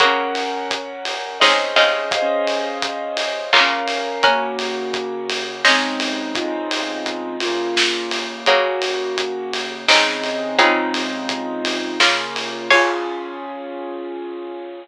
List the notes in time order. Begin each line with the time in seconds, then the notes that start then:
0.00 C#3 A#3 F#4 A#4 F#5, kick, closed hi-hat
0.05 C#4
0.35 open hi-hat
0.71 kick, closed hi-hat
1.05 open hi-hat
1.40 C#3 G#3 C4 D#4 C5 D#5, kick, snare
1.46 C#4 G#4
1.76 C#3 G#3 C4 D#4 F4, open hi-hat
2.11 D#5 F5, kick, closed hi-hat
2.17 G#4 C5
2.22 C#4
2.47 open hi-hat
2.82 kick, closed hi-hat
3.17 open hi-hat
3.53 C#3 A#3 F4 F5, kick, clap
3.57 C#4 A#4
3.87 open hi-hat
4.23 A#3 C#4 F#4 A#4 F#5, kick, closed hi-hat
4.30 C#3
4.59 open hi-hat
4.94 kick, closed hi-hat
5.30 open hi-hat
5.64 C4 C#4 D#4 G#4 C5 D#5, kick, snare
5.70 C#3 G#3
6.00 open hi-hat
6.35 D#4 F4, kick, closed hi-hat
6.42 G#3 C4
6.47 C#3
6.71 open hi-hat
7.06 kick, closed hi-hat
7.40 A#3 F4, open hi-hat
7.47 C#3
7.76 kick, snare
8.11 open hi-hat
8.46 C#3 F#3 A#3 F#4, kick, closed hi-hat
8.52 C#3
8.82 open hi-hat
9.18 kick, closed hi-hat
9.53 open hi-hat
9.88 C#3 G#3 C4 D#4, kick, snare
9.94 C#3 G#3
10.24 open hi-hat
10.59 C#3 G#3 C4 D#4 F4, kick, closed hi-hat
10.64 G#3 C4
10.70 C#3
10.94 open hi-hat
11.29 kick, closed hi-hat
11.65 open hi-hat
12.00 C#3 A#3 F4, kick, snare
12.05 C#3
12.36 open hi-hat
12.70 F4 G#4 C#5 F5 G#5, kick, crash
12.76 C#4